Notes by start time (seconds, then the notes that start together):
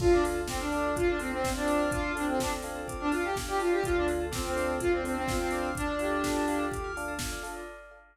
0.00 D2 D4 F4 A4, kick, crash
0.12 D4 D5
0.24 D4 F4 A4 F5, open hi-hat
0.35 A5
0.48 C4 D6, kick, snare
0.60 D4 F6
0.72 D4 F4 A4 D6, open hi-hat
0.84 A5
0.96 F4 F5, kick, closed hi-hat
1.08 D4 D5
1.19 C4 D4 F4 A4, open hi-hat
1.31 C4 D5
1.44 C4 F5, kick, snare
1.56 D4 A5
1.66 D4 F4 A4 D6, open hi-hat
1.79 F6
1.91 D4 F4 D6, kick, closed hi-hat
2.04 A5
2.15 C4 D4 F4 A4 F5, open hi-hat
2.27 C4 D5
2.40 D4 A4, kick, snare
2.53 D5
2.62 D4 F4 A4 F5, open hi-hat
2.75 A5
2.88 D6, kick, closed hi-hat
3.00 D4 F6
3.11 D4 F4 A4 D6, open hi-hat
3.24 G4 A5
3.36 F5, kick, snare
3.48 G4 D5
3.59 D4 F4 A4, open hi-hat
3.72 G4 D5
3.83 D2 D4 F4 A4, kick, closed hi-hat
3.95 D4 D5
4.07 D4 F4 A4 F5, open hi-hat
4.20 A5
4.31 C4 D6, kick, snare
4.44 C4 F6
4.56 D4 F4 A4 D6, open hi-hat
4.68 A5
4.80 F4 F5, kick, closed hi-hat
4.91 C4 D5
5.03 C4 D4 F4 A4, open hi-hat
5.16 C4 D5
5.27 F4 F5, kick, snare
5.40 C4 A5
5.50 D4 F4 A4 D6, open hi-hat
5.63 F6
5.75 D4 D6, kick, closed hi-hat
5.88 A5
5.99 D4 F4 G4 A4 F5, open hi-hat
6.11 D5
6.24 A4, kick, snare
6.36 D5
6.48 D4 F4 A4 F5, open hi-hat
6.59 A5
6.71 D6, kick, closed hi-hat
6.84 F6
6.96 D4 F4 A4 D6, open hi-hat
7.08 A5
7.19 F5, kick, snare
7.32 D5
7.43 D4 F4 A4, open hi-hat
7.56 D5